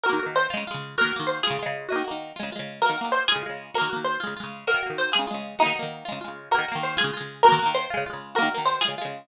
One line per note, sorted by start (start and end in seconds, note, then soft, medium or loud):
0.03 0.19 F#4 loud
0.03 0.32 A#4 loud
0.09 0.20 D#3 loud
0.09 0.20 A#3 loud
0.19 0.48 A#3 medium
0.19 0.48 F#4 medium
0.26 0.48 D#3 medium
0.36 0.49 C5 loud
0.50 0.64 G#3 loud
0.50 0.64 F4 loud
0.57 0.64 C#3 loud
0.67 0.96 G#3 medium
0.67 0.96 F4 loud
0.74 0.96 C#3 medium
0.98 1.12 A#3 loud
0.98 1.12 F#4 loud
0.98 1.23 A#4 loud
1.05 1.12 D#3 loud
1.13 1.41 A#3 loud
1.13 1.41 F#4 loud
1.20 1.41 D#3 medium
1.27 1.39 C5 medium
1.43 1.58 G#3 loud
1.43 1.58 F4 loud
1.43 1.83 G#4 medium
1.50 1.58 C#3 loud
1.59 1.87 G#3 loud
1.59 1.87 F4 loud
1.66 1.87 C#3 loud
1.89 2.03 A#3 loud
1.89 2.03 F#4 loud
1.89 2.60 D#5 loud
1.96 2.03 D#3 loud
2.04 2.32 A#3 medium
2.04 2.32 F#4 medium
2.11 2.32 D#3 medium
2.36 2.50 G#3 loud
2.36 2.50 F4 loud
2.43 2.50 C#3 loud
2.52 2.81 G#3 medium
2.52 2.81 F4 loud
2.59 2.81 C#3 medium
2.82 2.96 A#3 medium
2.82 2.96 F#4 medium
2.82 3.08 A#4 medium
2.89 2.96 D#3 medium
2.98 3.26 A#3 medium
2.98 3.26 F#4 medium
3.04 3.26 D#3 medium
3.12 3.25 C5 medium
3.28 3.43 G#3 medium
3.28 3.42 F4 loud
3.28 3.69 G#4 medium
3.36 3.43 C#3 medium
3.43 3.71 G#3 medium
3.43 3.71 F4 medium
3.50 3.71 C#3 medium
3.74 3.89 A#3 loud
3.74 3.89 F#4 loud
3.74 4.05 A#4 medium
3.81 3.89 D#3 medium
3.89 4.18 A#3 medium
3.89 4.18 F#4 medium
3.96 4.18 D#3 medium
4.04 4.18 C5 medium
4.20 4.34 G#3 loud
4.20 4.34 F4 loud
4.27 4.34 C#3 medium
4.37 4.65 G#3 medium
4.37 4.65 F4 medium
4.44 4.65 C#3 medium
4.67 4.81 A#3 medium
4.67 4.81 F#4 medium
4.67 4.96 A#4 loud
4.74 4.81 D#3 medium
4.83 5.11 A#3 medium
4.83 5.11 F#4 medium
4.90 5.11 D#3 medium
4.98 5.11 C5 medium
5.12 5.26 G#3 medium
5.12 5.26 F4 medium
5.12 5.56 G#4 medium
5.19 5.26 C#3 loud
5.27 5.56 G#3 medium
5.27 5.56 F4 medium
5.34 5.56 C#3 medium
5.59 5.73 A#3 loud
5.59 6.17 D#4 medium
5.59 5.73 F#4 medium
5.66 5.73 D#3 loud
5.76 6.04 A#3 medium
5.76 6.04 F#4 medium
5.83 6.04 D#3 medium
6.05 6.19 G#3 medium
6.05 6.19 F4 loud
6.12 6.19 C#3 loud
6.21 6.49 G#3 medium
6.21 6.49 F4 medium
6.28 6.49 C#3 medium
6.51 6.66 A#3 loud
6.51 6.66 F#4 loud
6.51 6.79 A#4 loud
6.58 6.66 D#3 loud
6.68 6.97 A#3 loud
6.68 6.97 F#4 medium
6.75 6.97 D#3 loud
6.83 6.96 C5 medium
6.97 7.11 G#3 loud
6.97 7.11 F4 loud
6.97 7.41 G#4 medium
7.04 7.11 C#3 loud
7.13 7.42 G#3 loud
7.13 7.42 F4 loud
7.20 7.42 C#3 medium
7.43 7.58 F#4 loud
7.43 7.71 A#4 loud
7.48 7.59 D#3 loud
7.48 7.59 A#3 loud
7.59 7.87 A#3 medium
7.59 7.87 F#4 loud
7.66 7.87 D#3 loud
7.75 7.88 C5 loud
7.90 8.04 G#3 loud
7.90 8.04 F4 loud
7.97 8.04 C#3 loud
8.06 8.35 G#3 medium
8.06 8.35 F4 loud
8.13 8.35 C#3 medium
8.35 8.49 A#3 loud
8.35 8.49 F#4 loud
8.35 8.63 A#4 loud
8.42 8.49 D#3 loud
8.51 8.79 A#3 medium
8.51 8.79 F#4 medium
8.58 8.79 D#3 medium
8.66 8.81 C5 loud
8.81 8.95 G#3 loud
8.81 8.95 F4 loud
8.81 9.19 G#4 medium
8.88 8.95 C#3 medium
8.98 9.26 G#3 loud
8.98 9.26 F4 loud
9.05 9.26 C#3 medium